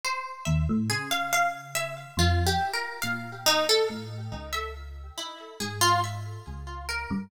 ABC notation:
X:1
M:5/8
L:1/16
Q:1/4=70
K:none
V:1 name="Orchestral Harp"
c2 e z | ^G f f z e z (3F2 =G2 ^A2 | f2 ^D A z3 e z2 | E2 ^G F e2 z2 ^A2 |]
V:2 name="Electric Piano 1" clef=bass
z2 ^D,, A,, | ^C,6 F,,2 z2 | ^A,,4 =A,,2 ^C,,4 | z2 ^G,,4 ^C,,3 =G,, |]